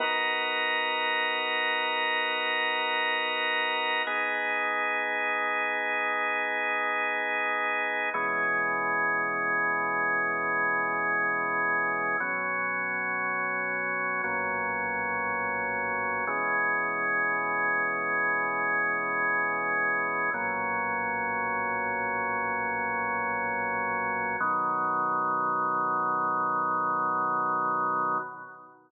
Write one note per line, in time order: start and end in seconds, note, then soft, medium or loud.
0.00 4.02 B3 medium
0.00 4.02 D#4 medium
0.00 4.02 F#4 medium
0.00 4.02 A#4 medium
4.07 8.10 B3 medium
4.07 8.10 D#4 medium
4.07 8.10 G#4 medium
8.14 12.17 B2 medium
8.14 12.17 E3 medium
8.14 12.17 G#3 medium
8.14 12.17 C#4 medium
12.20 14.22 B2 medium
12.20 14.22 F#3 medium
12.20 14.22 C#4 medium
14.24 16.25 B1 medium
14.24 16.25 A#2 medium
14.24 16.25 F#3 medium
14.24 16.25 C#4 medium
16.27 20.30 B2 medium
16.27 20.30 E3 medium
16.27 20.30 G#3 medium
16.27 20.30 C#4 medium
20.34 24.36 B1 medium
20.34 24.36 A#2 medium
20.34 24.36 F#3 medium
20.34 24.36 C#4 medium
24.40 28.18 B2 loud
24.40 28.18 D#3 medium
24.40 28.18 F#3 medium